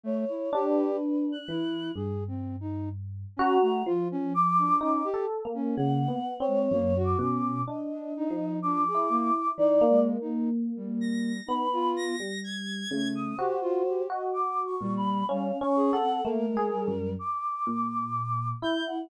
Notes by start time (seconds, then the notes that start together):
0.03 A3 C#5
0.29 E4
0.53 D4 G4
0.68 B4
1.32 F#6
1.48 E3 E4
1.95 G2 G#4
2.28 C4
2.60 D#4
3.37 C#4 F#4 A#5
3.62 A3
3.86 F3 F4
4.12 C#4
4.34 D6
4.58 D4
4.81 C#4 D#4 D6
5.04 G4
5.14 A4
5.45 A#3
5.54 C#4
5.76 C#3 A#3 F#5
6.08 B3
6.40 C4 C#5
6.47 G#3
6.71 F#2 A#3
6.96 F#4
7.04 D6
7.19 B2 C#4
7.67 D4 D#5
7.92 D4
8.17 D#4
8.30 F3
8.62 D4 D6
8.87 G#4
8.94 E4
9.09 A#3
9.58 E3 D#4 D5
9.81 A#3
9.89 G#3
10.21 D#4
10.76 G3
11.01 A#6
11.46 B3 D#4 B5
11.73 F4
11.96 A#6
12.20 G3
12.44 G#6
12.91 C#3 A3
13.15 D#6
13.38 F#4 G4 C5
13.61 F4
13.88 G4
14.10 F#4 D#5
14.33 D6
14.65 C#6
14.81 A#2 G3
14.97 B5
15.28 G3 C#4 F5
15.61 C#4 C#6
15.76 G#4
15.92 A4 F#5
16.00 C4
16.24 A3 A#3 A#4
16.49 G#3
16.57 G#4
16.72 G3
16.88 F#2
17.19 D6
17.67 A#2
18.62 E4 G6
18.87 F#5